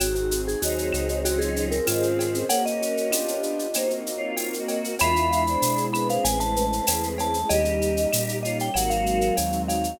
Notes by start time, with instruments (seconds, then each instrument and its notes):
0.00 synth bass 1 G#1, pad 2 (warm) C4 D#4 F#4 G#4, acoustic grand piano C4, vibraphone F#4, cowbell, claves, shaker
0.15 vibraphone F#4, shaker
0.31 acoustic grand piano G#4, shaker
0.48 vibraphone G#4, shaker
0.62 synth bass 1 D#2, choir aahs F#3 D#4, pad 2 (warm) C4 D#4 G#4 C5, acoustic grand piano C4, vibraphone F#4, tambourine, shaker
0.78 shaker
0.93 synth bass 1 C#2, acoustic grand piano F#4, claves, shaker
1.09 shaker
1.24 pad 2 (warm) C4 C#4 F4 G#4, acoustic grand piano C4, vibraphone F#4, cowbell, shaker
1.39 vibraphone G#4, shaker
1.56 acoustic grand piano C#4, shaker
1.71 vibraphone A#4, shaker
1.87 synth bass 1 G#2, choir aahs D#3 C4, pad 2 (warm) C4 C#4 G#4 C5, vibraphone F4, acoustic grand piano F4, tambourine, cowbell, claves, shaker
2.03 shaker
2.19 acoustic grand piano G#4, cowbell, shaker
2.34 shaker
2.49 pad 2 (warm) A#3 C#4 F#4, acoustic grand piano A#3, choir aahs C#4 A#4, vibraphone F#5, cowbell, shaker
2.66 vibraphone D#5, shaker
2.81 acoustic grand piano F#4, shaker
2.97 shaker
3.11 acoustic grand piano B3 D4 F4 G4, pad 2 (warm) B3 D4 F4 G4, tambourine, claves, shaker
3.28 shaker
3.43 shaker
3.59 shaker
3.74 pad 2 (warm) A#3 C4 D#4 F#4, acoustic grand piano A#3, choir aahs D#4 C5, cowbell, claves, shaker
3.90 shaker
4.05 acoustic grand piano C4, shaker
4.17 choir aahs F4 C#5
4.37 pad 2 (warm) A#3 C4 F#4 A#4, acoustic grand piano D#4, tambourine, cowbell, shaker
4.54 shaker
4.58 choir aahs F#4 D#5
4.68 acoustic grand piano F#4, cowbell, shaker
4.84 shaker
4.99 synth bass 1 E2, acoustic grand piano G#3, pad 2 (warm) G#3 B3 D4 E4, choir aahs F4 E5, vibraphone B5, cowbell, claves, shaker
5.16 shaker
5.31 acoustic grand piano E4, shaker
5.47 choir aahs D4 C5, shaker
5.61 synth bass 1 B2, pad 2 (warm) G#3 B3 E4 G#4, acoustic grand piano G#3, tambourine, shaker
5.77 shaker
5.93 choir aahs C4 B4, acoustic grand piano D4, vibraphone B5, claves, shaker
6.09 vibraphone F5, shaker
6.24 synth bass 1 A1, acoustic grand piano G#3, pad 2 (warm) G#3 A3 C#4 E4, vibraphone G#5, cowbell, shaker
6.40 vibraphone A5, shaker
6.56 acoustic grand piano A3, shaker
6.73 shaker
6.87 synth bass 1 E2, pad 2 (warm) G#3 A3 E4 G#4, acoustic grand piano C#4, tambourine, cowbell, claves, shaker
7.03 shaker
7.18 acoustic grand piano E4, vibraphone A5, cowbell, shaker
7.34 shaker
7.49 synth bass 1 D#2, acoustic grand piano G3, pad 2 (warm) G3 A#3 C#4 D#4, choir aahs G4 D#5, vibraphone D#5, cowbell, shaker
7.65 shaker
7.81 acoustic grand piano D#4, shaker
7.97 shaker
8.11 synth bass 1 A#2, acoustic grand piano G3, pad 2 (warm) G3 A#3 D#4 G4, tambourine, claves, shaker
8.29 shaker
8.43 acoustic grand piano C#4, choir aahs F4 C#5, vibraphone D#5, shaker
8.59 vibraphone G5, shaker
8.74 synth bass 1 G#1, pad 2 (warm) F#3 G#3 C4 D#4, acoustic grand piano F#3, choir aahs A#3 F#4, vibraphone F#5, cowbell, claves, shaker
8.90 vibraphone F5, shaker
9.06 acoustic grand piano G#3, shaker
9.21 shaker
9.37 synth bass 1 D#2, pad 2 (warm) F#3 G#3 D#4 F#4, acoustic grand piano C4, tambourine, cowbell, shaker
9.52 shaker
9.68 acoustic grand piano D#4, vibraphone F5, cowbell, shaker
9.84 shaker